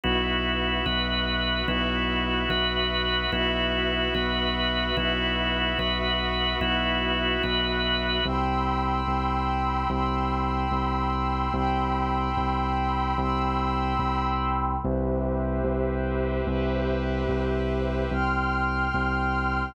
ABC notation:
X:1
M:6/8
L:1/8
Q:3/8=73
K:Bmix
V:1 name="Drawbar Organ"
[B,EF]3 [B,FB]3 | [B,EF]3 [B,FB]3 | [B,EF]3 [B,FB]3 | [B,EF]3 [B,FB]3 |
[B,EF]3 [B,FB]3 | [K:Cmix] z6 | z6 | z6 |
z6 | z6 | z6 | z6 |]
V:2 name="Pad 5 (bowed)"
[FBe]6 | [FBe]6 | [FBe]6 | [FBe]6 |
[FBe]6 | [K:Cmix] [g=bc'e']6 | [g=bc'e']6 | [g=bc'e']6 |
[g=bc'e']6 | [G=Bce]6 | [G=Bce]6 | [gc'f']6 |]
V:3 name="Synth Bass 2" clef=bass
B,,,3 B,,,3 | B,,,3 B,,,3 | B,,,3 B,,,3 | B,,,3 B,,,3 |
B,,,3 B,,,3 | [K:Cmix] C,,3 C,,3 | C,,3 C,,3 | C,,3 C,,3 |
C,,3 C,,3 | C,,3 C,,3 | C,,3 C,,3 | C,,3 C,,3 |]